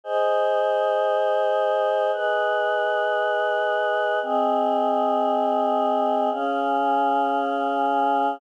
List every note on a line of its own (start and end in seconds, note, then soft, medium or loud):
0.04 2.11 G#4 medium
0.04 2.11 C5 medium
0.04 2.11 D#5 medium
2.12 4.19 G#4 medium
2.12 4.19 B4 medium
2.12 4.19 D#5 medium
4.22 6.30 C4 medium
4.22 6.30 G#4 medium
4.22 6.30 D#5 medium
6.31 8.38 C#4 medium
6.31 8.38 G#4 medium
6.31 8.38 F5 medium